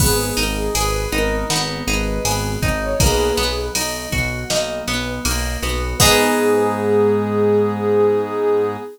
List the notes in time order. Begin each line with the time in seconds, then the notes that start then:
0.00 G#1 B3 G#4, kick, crash
0.37 G#1 D#4 A#4, ride
0.56 G#4
0.75 G#1 G#4 B4, ride
1.12 G#1 B3 D#4 A#4, ride
1.50 G#1 B3 D#4, snare
1.87 G#1 D#4 G#4 B4, ride
2.25 G#1 B3 G#4, ride
2.62 G#1 D#4, kick, ride
2.82 C#5
3.00 B1 A#3 G#4 B4, kick, ride
3.37 B1 B3, ride
3.75 B1 D#4, ride
4.12 B1 F#4, kick, ride
4.50 B1 A#3 D#4, snare
4.88 B1 B3, ride
5.25 B1 A#3 D#4, ride
5.62 B1 B3 F#4, ride
6.00 G#2 B3 D#4 G#4, kick, crash